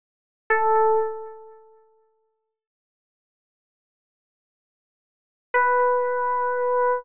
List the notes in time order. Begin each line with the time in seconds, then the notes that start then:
0.50 A4
5.54 B4